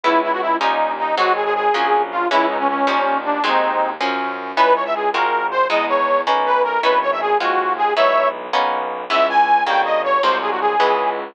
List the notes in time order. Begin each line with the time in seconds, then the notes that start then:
0.04 C#2 G#3 B3 C#4 E4
0.23 E4
0.32 F#4
0.41 E4
0.60 D#2 G3 C#4 D#4 F4
0.99 D#4
1.17 G#1 F#3 G#3 C4 D#4 F#4
1.36 G#4
1.45 G#4
1.55 G#4
1.73 A#1 F3 F#3 A#3 C#4
2.11 F4
2.30 C#2 E3 G#3 B3 C#4 E4
2.49 D#4
2.59 C#4
2.68 C#4
2.87 D#2 D#3 F3 G3 C#4
3.25 D4
3.43 D#2 D#3 F#3 G#3 C4 D#4
4.00 F#2 F3 F#3 A#3 C#4
4.56 C#2 B3 C#4 D#4 E4 B4
4.75 C#5
4.85 E5
4.95 G#4
5.13 G#1 G#3 C4 F4 F#4 A#4
5.51 C5
5.69 E2 G#3 B3 D#4 E4 D#5
5.89 C#5
6.26 B1 A#3 B3 C#4 D#4
6.46 B4
6.64 A#4
6.83 G#1 B3 C#4 D#4 E4 B4
7.02 C#5
7.12 E5
7.21 G#4
7.40 D#2 G#3 C4 F4 F#4
7.78 G#4
7.96 B1 G#3 B3 D#4 E4 C#5 E5
8.52 B1 A#3 B3 C#4 D#4
9.10 C#2 C#3 E3 G#3 B3 E5
9.29 G#5
9.66 G1 C#3 D#3 G3 A#3 G5
9.85 D#5
10.04 C#5
10.23 C2 C3 F#3 G#3 A#3 C5
10.42 G#4
10.51 F#4
10.61 G#4
10.79 C#2 C#3 E3 G#3 B3